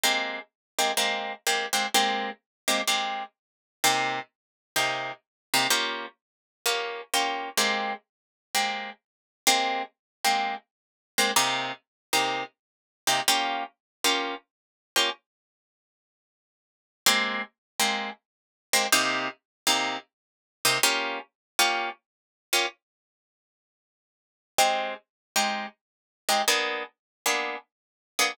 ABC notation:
X:1
M:4/4
L:1/8
Q:"Swing" 1/4=127
K:Ab
V:1 name="Acoustic Guitar (steel)"
[A,B,CG]3 [A,B,CG] [A,B,CG]2 [A,B,CG] [A,B,CG] | [A,B,CG]3 [A,B,CG] [A,B,CG]4 | [C,B,EG]4 [C,B,EG]3 [C,B,EG] | [B,DFG]4 [B,DFG]2 [B,DFG]2 |
[A,B,CG]4 [A,B,CG]4 | [A,B,CG]3 [A,B,CG]4 [A,B,CG] | [C,B,EG]3 [C,B,EG]4 [C,B,EG] | [B,DFG]3 [B,DFG]4 [B,DFG] |
z8 | [A,B,CG]3 [A,B,CG]4 [A,B,CG] | [C,B,EG]3 [C,B,EG]4 [C,B,EG] | [B,DFG]3 [B,DFG]4 [B,DFG] |
z8 | [A,CEG]3 [A,CEG]4 [A,CEG] | [B,_C=DA]3 [B,CDA]4 [B,CDA] |]